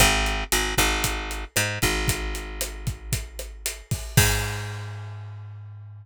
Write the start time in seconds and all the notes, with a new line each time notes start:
0.00 G#1, kick, cross-stick, closed hi-hat
0.26 closed hi-hat
0.52 G#1, closed hi-hat
0.78 G#1, kick, cross-stick, closed hi-hat
1.04 kick, closed hi-hat
1.31 closed hi-hat
1.56 G#2, cross-stick, closed hi-hat
1.82 G#1, kick, closed hi-hat
2.08 kick, closed hi-hat
2.35 closed hi-hat
2.61 cross-stick, closed hi-hat
2.87 kick, closed hi-hat
3.12 kick, closed hi-hat
3.39 cross-stick, closed hi-hat
3.66 closed hi-hat
3.91 kick, open hi-hat
4.17 G#2, kick, crash